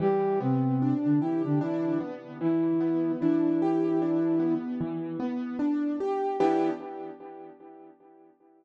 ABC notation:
X:1
M:4/4
L:1/16
Q:"Swing 16ths" 1/4=75
K:Em
V:1 name="Flute"
[G,G]2 [C,C]3 [D,D] [E,E] [D,D] [E,E]2 z2 [E,E]4 | [E,E]8 z8 | E4 z12 |]
V:2 name="Acoustic Grand Piano"
E,2 B,2 D2 G2 D2 B,2 E,2 B,2 | D2 G2 D2 B,2 E,2 B,2 D2 G2 | [E,B,DG]4 z12 |]